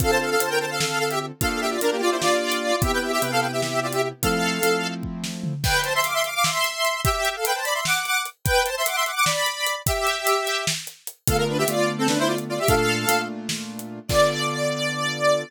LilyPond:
<<
  \new Staff \with { instrumentName = "Lead 1 (square)" } { \time 7/8 \key d \minor \tempo 4 = 149 <a' f''>16 <c'' a''>16 <a' f''>16 <a' f''>16 <c'' a''>16 <bes' g''>16 <c'' a''>16 <a' f''>16 <a' f''>8 <a' f''>16 <g' e''>16 r8 | <a' f''>8 <g' e''>16 <f' d''>16 <d' bes'>16 <bes g'>16 <f' d''>16 <e' c''>16 <f' d''>4. | <g' e''>16 <b' g''>16 <g' e''>16 <g' e''>16 <b' g''>16 <a' f''>16 <b' g''>16 <g' e''>16 <g' e''>8 <f' d''>16 <g' e''>16 r8 | <a' f''>2 r4. |
\key a \minor <b' g''>8 <c'' a''>16 <e'' c'''>16 <f'' d'''>16 <e'' c'''>16 <f'' d'''>16 <f'' d'''>16 <e'' c'''>4. | <g' e''>8. <a' f''>16 <b' g''>16 <c'' a''>16 <d'' b''>16 <e'' c'''>16 <fis'' d'''>8 <fis'' d'''>8 r8 | <b' g''>8 <c'' a''>16 <e'' c'''>16 <fis'' d'''>16 <e'' c'''>16 <fis'' d'''>16 <fis'' d'''>16 <d'' b''>4. | <g' e''>2 r4. |
\key d \minor <a' f''>16 ais'16 <d' b'>16 <g' e''>16 <f' d''>8. <c' a'>16 <d' b'>16 <e' c''>16 <f' d''>16 r16 <f' d''>16 <g' e''>16 | <a' f''>4. r2 | d''2.~ d''8 | }
  \new Staff \with { instrumentName = "Acoustic Grand Piano" } { \time 7/8 \key d \minor <d c' f' a'>4 <d c' f' a'>2~ <d c' f' a'>8 | <bes d' f' g'>4 <bes d' f' g'>2~ <bes d' f' g'>8 | <c b e' g'>4 <c b e' g'>2~ <c b e' g'>8 | <f a c' e'>4 <f a c' e'>2~ <f a c' e'>8 |
\key a \minor r2. r8 | r2. r8 | r2. r8 | r2. r8 |
\key d \minor <d a b f'>4 <d a b f'>2~ <d a b f'>8 | <bes, a d' f'>4 <bes, a d' f'>2~ <bes, a d' f'>8 | <d b f' a'>2.~ <d b f' a'>8 | }
  \new DrumStaff \with { instrumentName = "Drums" } \drummode { \time 7/8 <hh bd>4 hh4 sn8. hh8. | <hh bd>4 hh4 sn8. hh8. | <hh bd>4 hh4 sn8. hh8. | <hh bd>4 hh4 bd8 sn8 tomfh8 |
<cymc bd>8 hh8 hh8 hh8 sn8 hh8 hh8 | <hh bd>8 hh8 hh8 hh8 sn8 hh8 hh8 | <hh bd>8 hh8 hh8 hh8 sn8 hh8 hh8 | <hh bd>8 hh8 hh8 hh8 sn8 hh8 hh8 |
<hh bd>4 hh4 sn8. hh8. | <hh bd>4 hh4 sn8. hh8. | <cymc bd>4 r4 r4. | }
>>